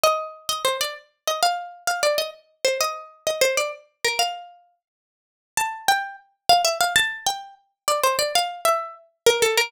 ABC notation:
X:1
M:9/8
L:1/8
Q:3/8=130
K:Eb
V:1 name="Pizzicato Strings"
e3 e c d z2 e | f3 f d e z2 c | e3 e c d z2 B | f4 z5 |
[K:F] a2 g2 z2 f e f | a2 g2 z2 d c d | f2 e2 z2 B A B |]